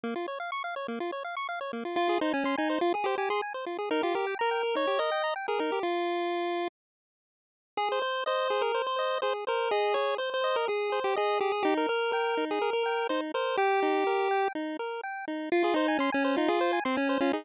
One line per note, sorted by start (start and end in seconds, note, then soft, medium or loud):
0.04 0.14 A#3 medium
0.16 0.27 F4 medium
0.28 0.39 C#5 medium
0.40 0.51 F5 medium
0.52 0.63 C#6 medium
0.64 0.75 F5 medium
0.76 0.87 C#5 medium
0.88 0.99 A#3 medium
1.00 1.11 F4 medium
1.12 1.23 C#5 medium
1.24 1.35 F5 medium
1.37 1.47 C#6 medium
1.49 1.60 F5 medium
1.61 1.72 C#5 medium
1.73 1.84 A#3 medium
1.85 1.96 F4 medium
1.96 2.18 F4 medium
1.96 2.08 F4 medium
2.09 2.20 G#4 medium
2.21 2.33 D#4 medium
2.21 2.32 C5 medium
2.33 2.44 C#4 medium
2.33 2.44 G#5 medium
2.44 2.56 C#4 medium
2.44 2.56 C6 medium
2.58 2.79 D#4 medium
2.58 2.68 G#5 medium
2.70 2.81 C5 medium
2.81 2.93 F4 medium
2.94 3.05 G#4 medium
2.94 3.06 G#4 medium
3.04 3.15 G4 medium
3.04 3.17 C5 medium
3.18 3.29 G4 medium
3.18 3.29 G#5 medium
3.30 3.41 G#4 medium
3.30 3.41 C6 medium
3.42 3.53 G#5 medium
3.54 3.65 C5 medium
3.66 3.77 F4 medium
3.79 3.89 G#4 medium
3.91 4.02 D#4 medium
3.91 4.02 A#4 medium
4.03 4.15 F4 medium
4.03 4.14 G4 medium
4.15 4.35 G4 medium
4.15 4.26 A#4 medium
4.27 4.38 G5 medium
4.39 4.76 A#4 medium
4.39 4.50 A#5 medium
4.51 4.62 G5 medium
4.63 4.74 A#4 medium
4.75 4.86 D#4 medium
4.75 5.00 C#5 medium
4.87 4.98 G4 medium
4.99 5.10 A#4 medium
4.99 5.34 D#5 medium
5.12 5.22 G5 medium
5.24 5.35 A#5 medium
5.36 5.47 G5 medium
5.48 5.60 G#4 medium
5.48 5.59 A#4 medium
5.59 5.71 D#4 medium
5.59 5.79 A#4 medium
5.72 5.83 G4 medium
5.83 6.68 F4 medium
7.77 7.89 G#4 medium
7.77 7.99 G#4 medium
7.92 8.02 C5 medium
8.02 8.24 C5 medium
8.26 8.62 C5 medium
8.26 8.48 D#5 medium
8.50 8.72 G#4 medium
8.61 8.82 A#4 medium
8.74 8.96 C5 medium
8.87 9.18 C5 medium
8.99 9.20 D#5 medium
9.22 9.45 G#4 medium
9.22 9.33 C5 medium
9.47 9.71 A#4 medium
9.47 9.69 C5 medium
9.71 9.95 G#4 medium
9.71 9.93 D#5 medium
9.94 10.17 G#4 medium
9.94 10.15 C#5 medium
10.18 10.30 C5 medium
10.18 10.41 C5 medium
10.34 10.56 C5 medium
10.44 10.66 D#5 medium
10.56 10.67 A#4 medium
10.68 10.90 G#4 medium
10.68 11.00 G#4 medium
10.92 11.14 C5 medium
11.04 11.16 G4 medium
11.16 11.40 G#4 medium
11.16 11.38 D#5 medium
11.41 11.52 G4 medium
11.41 11.62 G#4 medium
11.52 11.64 G#4 medium
11.63 11.87 D#4 medium
11.63 11.74 G4 medium
11.78 11.89 A#4 medium
11.89 12.11 A#4 medium
11.89 12.12 A#4 medium
12.12 12.45 A#4 medium
12.12 12.35 G5 medium
12.37 12.59 D#4 medium
12.51 12.70 G#4 medium
12.62 12.83 A#4 medium
12.73 13.07 A#4 medium
12.86 13.08 G5 medium
13.09 13.32 D#4 medium
13.09 13.21 C5 medium
13.34 13.56 A#4 medium
13.34 13.57 C5 medium
13.57 14.48 G4 medium
13.57 13.80 G5 medium
13.83 14.04 D#4 medium
14.07 14.29 A#4 medium
14.31 14.53 G5 medium
14.55 14.77 D#4 medium
14.79 15.01 A#4 medium
15.04 15.25 G5 medium
15.28 15.49 D#4 medium
15.52 15.63 F4 loud
15.52 15.74 F4 medium
15.64 15.75 G#4 medium
15.74 15.98 D#4 medium
15.74 15.87 C5 medium
15.88 15.99 G#5 medium
15.99 16.10 C#4 medium
15.99 16.11 C6 medium
16.12 16.36 C#4 medium
16.12 16.23 G#5 medium
16.24 16.35 C5 medium
16.37 16.49 D#4 medium
16.37 16.47 F4 medium
16.48 16.80 F4 medium
16.48 16.60 G#4 medium
16.61 16.72 C5 loud
16.73 16.84 G#5 medium
16.85 16.97 C4 medium
16.85 16.96 C6 medium
16.97 17.18 C#4 medium
16.97 17.08 G#5 medium
17.09 17.20 C5 medium
17.21 17.32 C#4 medium
17.21 17.32 F4 medium
17.33 17.45 D#4 medium
17.33 17.44 G#4 medium